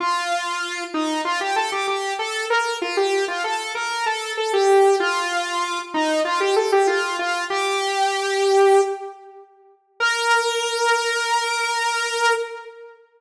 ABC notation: X:1
M:4/4
L:1/16
Q:1/4=96
K:Bb
V:1 name="Lead 2 (sawtooth)"
F6 E2 F G A G G2 A2 | B2 F G2 F A2 B2 A2 A G3 | F6 E2 F G A G F2 F2 | G10 z6 |
B16 |]